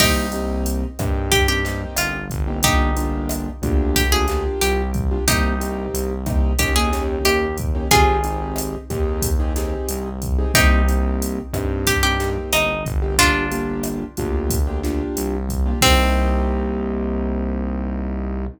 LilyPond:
<<
  \new Staff \with { instrumentName = "Acoustic Guitar (steel)" } { \time 4/4 \key c \minor \tempo 4 = 91 <ees' g'>2 g'16 g'8 r16 f'8 r8 | <ees' g'>2 g'16 aes'8 r16 g'8 r8 | <ees' g'>2 g'16 aes'8 r16 g'8 r8 | <f' aes'>4. r2 r8 |
<ees' g'>2 g'16 g'8 r16 ees'8 r8 | <d' f'>2 r2 | c'1 | }
  \new Staff \with { instrumentName = "Acoustic Grand Piano" } { \time 4/4 \key c \minor <bes c' ees' g'>8 <bes c' ees' g'>4 <bes c' ees' g'>8. <bes c' ees' g'>16 <bes c' ees' g'>4~ <bes c' ees' g'>16 <bes c' ees' g'>16 | <bes d' f' g'>8 <bes d' f' g'>4 <bes d' f' g'>8. <bes d' f' g'>16 <bes d' f' g'>4~ <bes d' f' g'>16 <bes d' f' g'>16 | <bes c' ees' g'>8 <bes c' ees' g'>4 <bes c' ees' g'>8 <bes des' ees' g'>16 <bes des' ees' g'>16 <bes des' ees' g'>4~ <bes des' ees' g'>16 <bes des' ees' g'>16 | <c' ees' g' aes'>8 <c' ees' g' aes'>4 <c' ees' g' aes'>8. <c' ees' g' aes'>16 <c' ees' g' aes'>4~ <c' ees' g' aes'>16 <c' ees' g' aes'>16 |
<bes c' ees' g'>8 <bes c' ees' g'>4 <bes c' ees' g'>8. <bes c' ees' g'>16 <bes c' ees' g'>4~ <bes c' ees' g'>16 <bes c' ees' g'>16 | <bes d' f' g'>8 <bes d' f' g'>4 <bes d' f' g'>8. <bes d' f' g'>16 <bes d' f' g'>4~ <bes d' f' g'>16 <bes d' f' g'>16 | <bes c' ees' g'>1 | }
  \new Staff \with { instrumentName = "Synth Bass 1" } { \clef bass \time 4/4 \key c \minor c,4. g,4. g,,8 g,,8~ | g,,4. d,4. c,4 | c,4 c,4 ees,4 ees,4 | aes,,4. ees,4. c,4 |
c,4. g,4. g,,8 g,,8~ | g,,4. d,4. c,4 | c,1 | }
  \new DrumStaff \with { instrumentName = "Drums" } \drummode { \time 4/4 <cymc bd ss>8 hh8 hh8 <hh bd ss>8 <hh bd>8 <hh sn>8 <hh ss>8 <hh bd>8 | <hh bd>8 hh8 <hh ss>8 <hh bd>8 <hh bd>8 <hh sn>8 hh8 <hh bd>8 | <hh bd ss>8 hh8 hh8 <hh bd ss>8 <hh bd>8 <hh sn>8 <hh ss>8 <hh bd>8 | <hh bd>8 hh8 <hh ss>8 <hh bd>8 <hh bd>8 <hh sn>8 hh8 <hh bd>8 |
<hh bd ss>8 hh8 hh8 <hh bd ss>8 <hh bd>8 <hh sn>8 <hh ss>8 <hh bd>8 | <hh bd>8 hh8 <hh ss>8 <hh bd>8 <hh bd>8 <hh sn>8 hh8 <hh bd>8 | <cymc bd>4 r4 r4 r4 | }
>>